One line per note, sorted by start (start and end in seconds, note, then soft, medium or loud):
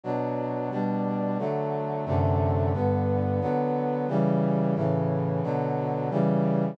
0.03 0.70 B2 medium
0.03 0.70 F#3 medium
0.03 0.70 D4 medium
0.71 1.38 B2 medium
0.71 1.38 G3 medium
0.71 1.38 D4 medium
1.38 2.05 D3 medium
1.38 2.05 F#3 medium
1.38 2.05 A3 medium
2.06 2.72 F#2 medium
2.06 2.72 C3 medium
2.06 2.72 D3 medium
2.06 2.72 A3 medium
2.73 3.40 G2 medium
2.73 3.40 D3 medium
2.73 3.40 B3 medium
3.41 4.07 D3 medium
3.41 4.07 F#3 medium
3.41 4.07 B3 medium
4.08 4.75 C#3 medium
4.08 4.75 E3 medium
4.08 4.75 G3 medium
4.75 5.42 A2 medium
4.75 5.42 C#3 medium
4.75 5.42 E3 medium
5.43 6.10 B2 medium
5.43 6.10 D3 medium
5.43 6.10 F#3 medium
6.10 6.77 C#3 medium
6.10 6.77 E3 medium
6.10 6.77 G3 medium